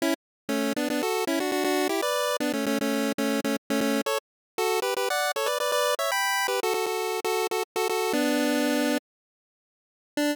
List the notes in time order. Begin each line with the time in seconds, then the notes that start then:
0.02 C#4 E4
0.49 A3 C#4
0.76 B3 D4
0.90 B3 D4
1.03 F#4 A4
1.27 C#4 E4
1.40 D4 F#4
1.52 D4 F#4
1.64 D4 F#4
1.89 E4 G4
2.02 B4 D5
2.40 B3 D4
2.53 A3 C#4
2.66 A3 C#4
2.81 A3 C#4
3.18 A3 C#4
3.44 A3 C#4
3.70 A3 C#4
3.81 A3 C#4
4.06 A4 C#5
4.58 F#4 A4
4.82 G4 B4
4.97 G4 B4
5.10 D5 F#5
5.36 A4 C#5
5.46 B4 D5
5.60 B4 D5
5.72 B4 D5
5.99 C#5 E5
6.12 G5 B5
6.48 G4 B4
6.63 F#4 A4
6.74 F#4 A4
6.86 F#4 A4
7.24 F#4 A4
7.51 F#4 A4
7.76 F#4 A4
7.89 F#4 A4
8.13 B3 D4
10.17 D4